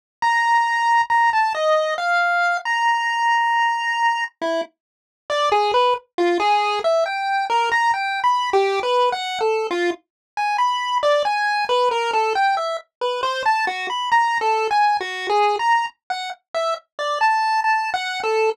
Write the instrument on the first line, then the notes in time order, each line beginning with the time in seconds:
lead 1 (square)
0.22 A#5
1.10 A#5
1.33 A5
1.55 D#5
1.98 F5
2.65 A#5
4.42 E4
5.30 D5
5.52 G#4
5.74 B4
6.18 F4
6.40 G#4
6.84 E5
7.06 G5
7.50 A#4
7.72 A#5
7.94 G5
8.24 B5
8.53 G4
8.83 B4
9.12 F#5
9.41 A4
9.71 F4
10.37 G#5
10.58 B5
11.03 D5
11.25 G#5
11.69 B4
11.91 A#4
12.13 A4
12.35 G5
12.57 E5
13.01 B4
13.23 C5
13.46 A5
13.67 F#4
13.90 B5
14.12 A#5
14.41 A4
14.71 G#5
15.01 F#4
15.29 G#4
15.59 A#5
16.10 F#5
16.54 E5
16.99 D5
17.21 A5
17.64 A5
17.94 F#5
18.24 A4